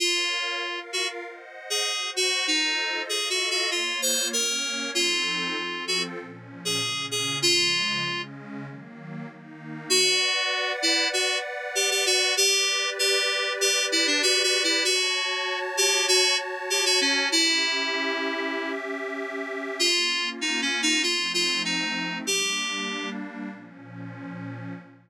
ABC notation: X:1
M:4/4
L:1/16
Q:1/4=97
K:Bbm
V:1 name="Electric Piano 2"
F6 G z4 A3 G2 | E4 (3A2 G2 G2 F2 c2 B4 | F6 G z4 A3 A2 | F6 z10 |
[K:Bm] F6 E2 F2 z2 G G F2 | G4 G4 G2 E D (3F2 F2 E2 | F6 G2 F2 z2 G F C2 | E10 z6 |
[K:Bbm] F4 (3E2 D2 E2 F2 F2 E4 | =G6 z10 |]
V:2 name="Pad 2 (warm)"
[Bdf]4 [FBf]4 [ceg]4 [Gcg]4 | [F=Ace]4 [FAef]4 [B,Fd]4 [B,Dd]4 | [F,CE=A]4 [F,CFA]4 [B,,F,D]4 [B,,D,D]4 | [D,F,A,]4 [D,A,D]4 [E,G,B,]4 [E,B,E]4 |
[K:Bm] [Bdf]16 | [GBd]16 | [Fca]16 | [CGe]16 |
[K:Bbm] [B,DF]8 [F,=A,CE]8 | [=G,B,=D]8 [B,,F,_D]8 |]